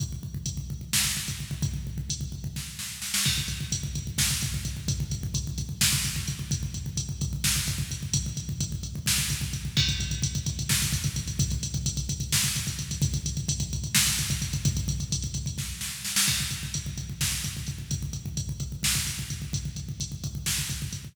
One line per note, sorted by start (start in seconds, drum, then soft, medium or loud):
0.00 kick loud
0.00 closed hi-hat medium
0.12 kick medium
0.23 kick medium
0.34 kick medium
0.46 kick medium
0.46 closed hi-hat loud
0.57 kick medium
0.70 kick medium
0.81 kick medium
0.93 kick medium
0.93 snare loud
1.05 kick medium
1.17 kick medium
1.28 kick medium
1.28 closed hi-hat medium
1.40 kick medium
1.51 kick medium
1.62 kick loud
1.62 closed hi-hat medium
1.74 kick medium
1.87 kick medium
1.98 kick medium
2.10 kick medium
2.10 closed hi-hat loud
2.21 kick medium
2.32 kick medium
2.44 kick medium
2.56 kick medium
2.56 snare medium
2.79 snare medium
3.02 snare medium
3.14 snare loud
3.25 kick loud
3.25 crash loud
3.38 kick medium
3.48 kick medium
3.48 closed hi-hat medium
3.61 kick medium
3.72 kick medium
3.72 closed hi-hat loud
3.83 kick medium
3.95 kick medium
3.95 closed hi-hat medium
4.07 kick medium
4.18 kick loud
4.18 snare loud
4.31 kick medium
4.41 kick medium
4.41 closed hi-hat medium
4.54 kick medium
4.65 kick medium
4.65 closed hi-hat medium
4.77 kick medium
4.88 kick loud
4.88 closed hi-hat loud
5.00 kick medium
5.11 kick medium
5.11 closed hi-hat medium
5.23 kick loud
5.34 kick loud
5.34 closed hi-hat loud
5.47 kick medium
5.58 kick medium
5.58 closed hi-hat medium
5.69 kick medium
5.81 kick loud
5.81 snare loud
5.93 kick loud
6.04 kick medium
6.04 closed hi-hat medium
6.16 kick medium
6.28 kick medium
6.28 closed hi-hat medium
6.39 kick medium
6.51 kick loud
6.51 closed hi-hat loud
6.63 kick medium
6.74 kick medium
6.74 closed hi-hat medium
6.86 kick medium
6.97 kick medium
6.97 closed hi-hat loud
7.09 kick medium
7.21 kick loud
7.21 closed hi-hat medium
7.33 kick medium
7.44 kick medium
7.44 snare loud
7.56 kick medium
7.67 kick loud
7.67 closed hi-hat medium
7.78 kick medium
7.91 kick medium
7.91 closed hi-hat medium
8.03 kick medium
8.13 kick loud
8.13 closed hi-hat loud
8.26 kick medium
8.37 kick medium
8.37 closed hi-hat medium
8.49 kick medium
8.60 kick loud
8.60 closed hi-hat loud
8.72 kick medium
8.83 kick medium
8.83 closed hi-hat medium
8.95 kick medium
9.06 kick medium
9.06 snare loud
9.18 kick medium
9.30 kick medium
9.30 closed hi-hat medium
9.41 kick medium
9.53 kick medium
9.53 closed hi-hat medium
9.65 kick medium
9.77 kick loud
9.77 crash loud
9.89 kick loud
9.89 closed hi-hat medium
10.00 kick medium
10.00 closed hi-hat medium
10.11 kick medium
10.11 closed hi-hat medium
10.22 kick loud
10.22 closed hi-hat loud
10.35 kick loud
10.35 closed hi-hat medium
10.46 kick loud
10.46 closed hi-hat loud
10.59 kick medium
10.59 closed hi-hat medium
10.69 kick loud
10.69 snare loud
10.82 kick medium
10.82 closed hi-hat medium
10.93 kick loud
10.93 closed hi-hat medium
11.04 kick loud
11.04 closed hi-hat medium
11.16 kick medium
11.16 closed hi-hat medium
11.28 kick medium
11.28 closed hi-hat medium
11.39 kick loud
11.39 closed hi-hat loud
11.50 kick loud
11.50 closed hi-hat medium
11.63 kick medium
11.63 closed hi-hat loud
11.74 kick loud
11.74 closed hi-hat medium
11.86 kick loud
11.86 closed hi-hat loud
11.97 kick medium
11.97 closed hi-hat medium
12.09 kick loud
12.09 closed hi-hat loud
12.20 kick medium
12.20 closed hi-hat medium
12.32 kick loud
12.32 snare loud
12.44 kick medium
12.44 closed hi-hat medium
12.56 kick medium
12.56 closed hi-hat medium
12.67 kick medium
12.67 closed hi-hat medium
12.79 kick medium
12.79 closed hi-hat medium
12.91 kick medium
12.91 closed hi-hat medium
13.02 kick loud
13.02 closed hi-hat loud
13.14 kick loud
13.14 closed hi-hat medium
13.26 kick medium
13.26 closed hi-hat loud
13.37 kick medium
13.37 closed hi-hat medium
13.48 kick loud
13.48 closed hi-hat loud
13.60 kick loud
13.60 closed hi-hat medium
13.73 kick medium
13.73 closed hi-hat medium
13.84 kick medium
13.84 closed hi-hat medium
13.95 kick loud
13.95 snare loud
14.07 kick medium
14.07 closed hi-hat medium
14.19 kick medium
14.19 closed hi-hat medium
14.30 kick loud
14.30 closed hi-hat medium
14.42 kick medium
14.42 closed hi-hat medium
14.53 kick loud
14.53 closed hi-hat medium
14.65 kick loud
14.65 closed hi-hat loud
14.77 kick loud
14.77 closed hi-hat medium
14.88 kick loud
14.88 closed hi-hat medium
15.00 kick medium
15.00 closed hi-hat medium
15.12 kick medium
15.12 closed hi-hat loud
15.22 kick medium
15.22 closed hi-hat medium
15.34 kick medium
15.34 closed hi-hat medium
15.46 kick medium
15.46 closed hi-hat medium
15.58 kick medium
15.58 snare medium
15.81 snare medium
16.05 snare medium
16.16 snare loud
16.28 kick loud
16.28 crash loud
16.40 kick medium
16.50 kick medium
16.50 closed hi-hat medium
16.63 kick medium
16.74 kick medium
16.74 closed hi-hat loud
16.86 kick medium
16.98 kick medium
16.98 closed hi-hat medium
17.09 kick medium
17.21 kick loud
17.21 snare loud
17.32 kick medium
17.44 kick medium
17.44 closed hi-hat medium
17.57 kick medium
17.67 kick medium
17.67 closed hi-hat medium
17.78 kick medium
17.91 kick loud
17.91 closed hi-hat medium
18.03 kick medium
18.13 kick medium
18.13 closed hi-hat medium
18.26 kick medium
18.37 kick medium
18.37 closed hi-hat medium
18.49 kick medium
18.60 kick medium
18.60 closed hi-hat medium
18.72 kick medium
18.83 kick medium
18.83 snare loud
18.95 kick medium
19.07 kick medium
19.07 closed hi-hat medium
19.19 kick medium
19.30 kick medium
19.30 closed hi-hat medium
19.42 kick medium
19.53 kick loud
19.53 closed hi-hat medium
19.65 kick medium
19.76 kick medium
19.76 closed hi-hat medium
19.89 kick medium
20.00 kick medium
20.00 closed hi-hat loud
20.12 kick medium
20.24 kick medium
20.24 closed hi-hat medium
20.35 kick medium
20.46 kick medium
20.46 snare loud
20.58 kick medium
20.69 kick medium
20.69 closed hi-hat medium
20.82 kick medium
20.93 kick medium
20.93 closed hi-hat medium
21.05 kick medium